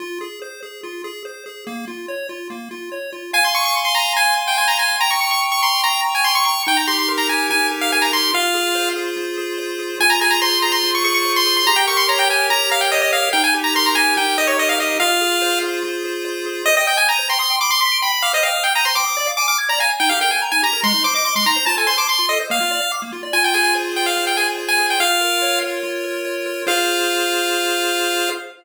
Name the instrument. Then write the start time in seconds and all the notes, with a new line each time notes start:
lead 1 (square)
0.00 F4
0.21 G#4
0.42 C5
0.63 G#4
0.83 F4
1.04 G#4
1.25 C5
1.46 G#4
1.67 A#3
1.88 F4
2.08 C#5
2.29 F4
2.50 A#3
2.71 F4
2.92 C#5
3.13 F4
3.33 F5 G#5
3.44 C6
3.54 G#5 C#6
3.65 C#6
3.75 C6
3.85 C6
3.95 G#5 A#5
4.16 F5 G#5
4.38 G#5
4.47 G5
4.58 G#5 C6
4.68 A#5
4.79 G#5
5.00 G5 A#5
5.11 C#6
5.21 A#5 C#6
5.31 C#6
5.42 C#6
5.52 C#6
5.63 A#5 C6
5.83 G5 A#5
6.04 A#5
6.15 G#5
6.24 C6 C#6
6.35 C#6
6.45 A#5 C#6
6.67 D#4 G5
6.77 A#5
6.88 G4 C6
6.99 C6
7.08 A#4
7.18 A#5
7.29 G4 G#5
7.50 D#4 G#5
7.71 G4
7.81 F5
7.92 A#4 G#5
8.02 A#5
8.13 G4 C6
8.33 F4 F5
8.54 G#4
8.75 C5
8.96 G#4
9.17 F4
9.38 G#4
9.58 C5
9.79 G#4
10.00 F4 G#5
10.10 A#5
10.21 G#4 G#5
10.31 A#5
10.42 C5 C6
10.62 G#4 A#5
10.72 C6
10.83 F4
10.95 C#6
11.04 G#4 C#6
11.14 C#6
11.25 C5
11.36 C6
11.46 G#4
11.57 C6
11.67 G4 A#5
11.76 G5
11.87 A#4 C#6
11.97 C6
12.08 C#5 A#5
12.19 G5
12.29 A#4 G#5
12.50 G4 A#5
12.71 A#4 F5
12.81 G5
12.92 C#5 D#5
13.02 D#5
13.13 A#4 F5
13.33 D#4 G5
13.44 G#5
13.54 G4
13.64 A#5
13.75 A#4 C6
13.86 A#5
13.95 G4 G#5
14.17 D#4 G5
14.38 G4 D#5
14.47 C#5
14.58 A#4 D#5
14.69 F5
14.79 G4 D#5
15.00 F4 F5
15.21 G#4
15.42 C5
15.63 G#4
15.83 F4
16.04 G#4
16.25 C5
16.46 G#4
16.66 C5 D#5
16.77 D#5 G5
16.87 G5 D#6
16.97 G#5 G6
17.08 A#5 D#7
17.19 C5
17.29 G5 C6
17.39 C6 D#6
17.50 G5
17.60 B5 D6
17.70 C6 D6
17.81 C6 B6
17.92 D7
18.02 G5 B5
18.13 B5
18.22 F5 D6
18.33 C5 D#5
18.43 F5 G5
18.54 D#6
18.64 G5 G6
18.75 A#5 D#7
18.85 C5 C6
18.95 G5 D6
19.06 D#6
19.17 D5
19.27 F5
19.37 G#5 D6
19.48 D6 F6
19.58 G#6
19.69 D5 A#5
19.79 F5 G#5
19.90 G#5
20.00 D#4 G5
20.09 G4 F5
20.21 A#4 G5
20.31 G5 G#5
20.42 A#5
20.52 D#4 G#5
20.63 G4 A#5
20.73 A#4
20.83 G#3 C6
20.94 D#4
21.04 C5 D6
21.15 D#5 D6
21.25 C6 D6
21.35 G#3 C6
21.46 D#4 A#5
21.56 C5
21.66 F4 A5
21.77 A4 G#5
21.87 C5 C6
21.98 A5 D6
22.08 C6
22.19 F4
22.29 A4 D#5
22.40 C5
22.50 A#3 F5
22.60 F4
22.71 D5
22.81 F5
22.92 D6
23.02 A#3
23.13 F4
23.23 D5
23.33 F4 G#5
23.44 G5
23.54 G#4 G#5
23.64 G#5
23.75 C5
23.96 G#4 G5
24.06 F5
24.17 F4
24.27 G5
24.37 G#4 G#5
24.58 C5
24.68 G#5
24.79 G#4
24.90 G5
25.00 F4 F5
25.21 A#4
25.42 C#5
25.63 A#4
25.83 F4
26.04 A#4
26.25 C#5
26.46 A#4
26.67 F4 G#4 C5 F5